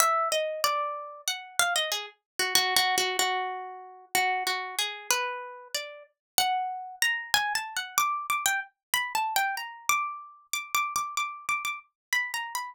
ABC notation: X:1
M:5/8
L:1/16
Q:1/4=94
K:none
V:1 name="Pizzicato Strings"
e2 _e2 d4 _g2 | f _e _A z2 _G (3G2 G2 G2 | _G6 G2 G2 | _A2 B4 d2 z2 |
_g4 _b2 (3_a2 =a2 g2 | d'2 d' g z2 (3b2 a2 g2 | _b2 d'4 (3d'2 d'2 d'2 | d'2 d' d' z2 (3b2 _b2 =b2 |]